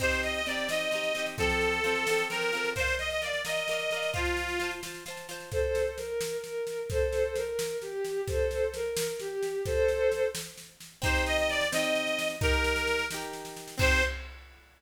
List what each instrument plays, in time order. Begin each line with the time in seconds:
0.00 orchestral harp C4 D#4 G4, accordion C5, kick, snare, crash
0.11 snare
0.23 accordion D#5, snare
0.34 accordion D#5, snare
0.46 orchestral harp C4 D#4, accordion D5, snare
0.51 orchestral harp G4
0.57 snare
0.68 orchestral harp C4 D#4, accordion D#5, snare
0.73 orchestral harp G4
0.80 snare
0.91 orchestral harp C4 D#4, snare
0.95 orchestral harp G4
1.03 snare
1.15 orchestral harp C4 D#4, snare
1.19 orchestral harp G4
1.26 snare
1.38 orchestral harp F3 C4, accordion A4, kick, snare
1.42 orchestral harp A4
1.50 snare
1.61 snare
1.72 snare
1.84 orchestral harp F3 C4, snare
1.88 orchestral harp A4
1.95 snare
2.07 orchestral harp F3 C4, snare
2.11 orchestral harp A4
2.18 snare
2.30 orchestral harp F3 C4, accordion A#4, snare
2.34 orchestral harp A4
2.41 snare
2.53 orchestral harp F3 C4, snare
2.57 orchestral harp A4
2.64 snare
2.76 orchestral harp A#4 D5, accordion C5, kick, snare
2.81 orchestral harp F5
2.87 snare
2.99 accordion D#5, snare
3.10 accordion D#5, snare
3.22 orchestral harp A#4 D5, accordion D5, snare
3.26 orchestral harp F5
3.33 snare
3.45 orchestral harp A#4 D5, accordion D#5, snare
3.50 orchestral harp F5
3.56 snare
3.68 orchestral harp A#4 D5, snare
3.73 orchestral harp F5
3.79 snare
3.91 orchestral harp A#4 D5, snare
3.96 orchestral harp F5
4.02 snare
4.14 orchestral harp F4 C5, accordion F4, kick, snare
4.18 orchestral harp A5
4.25 snare
4.37 snare
4.48 snare
4.60 orchestral harp F4 C5, snare
4.64 orchestral harp A5
4.71 snare
4.83 orchestral harp F4 C5, snare
4.87 orchestral harp A5
4.94 snare
5.06 orchestral harp F4 C5, snare
5.10 orchestral harp A5
5.17 snare
5.29 orchestral harp F4 C5, snare
5.33 orchestral harp A5
5.40 snare
5.52 violin A4 C5, kick, snare
5.75 snare
5.98 violin A#4, snare
6.21 snare
6.44 violin A#4, snare
6.67 snare
6.90 violin A4 C5, kick, snare
7.13 snare
7.36 violin A#4, snare
7.59 snare
7.82 violin G4, snare
8.05 snare
8.27 violin A4 C5, kick, snare
8.51 snare
8.74 violin A#4, snare
8.97 snare
9.19 violin G4, snare
9.43 snare
9.66 violin A4 C5, kick, snare
9.88 snare
10.12 snare
10.35 snare
10.58 snare
10.80 snare
11.02 orchestral harp C4 D#4, accordion C5, kick, snare
11.06 orchestral harp G4
11.15 snare
11.26 accordion D#5, snare
11.38 accordion D#5, snare
11.49 accordion D5, snare
11.61 snare
11.72 orchestral harp C4 D#4, accordion D#5, snare
11.76 orchestral harp G4
11.84 snare
11.95 snare
12.07 snare
12.19 snare
12.30 snare
12.41 orchestral harp D#4 G4, accordion A#4, kick, snare
12.45 orchestral harp A#4
12.53 snare
12.64 snare
12.76 snare
12.87 snare
12.99 snare
13.11 orchestral harp D#4 G4, snare
13.16 orchestral harp A#4
13.22 snare
13.33 snare
13.45 snare
13.56 snare
13.68 snare
13.78 orchestral harp C4 D#4, accordion C5, kick, crash
13.82 orchestral harp G4